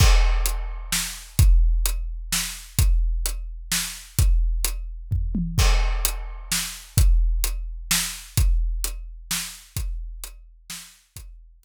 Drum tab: CC |x-----|------|------|------|
HH |--x---|x-x---|x-x---|x-x---|
SD |----o-|----o-|----o-|------|
T1 |------|------|------|-----o|
FT |------|------|------|----o-|
BD |o-----|o-----|o-----|o---o-|

CC |x-----|------|------|------|
HH |--x---|x-x---|x-x---|x-x---|
SD |----o-|----o-|----o-|----o-|
T1 |------|------|------|------|
FT |------|------|------|------|
BD |o-----|o-----|o-----|o-----|

CC |------|
HH |x-x---|
SD |------|
T1 |------|
FT |------|
BD |o-----|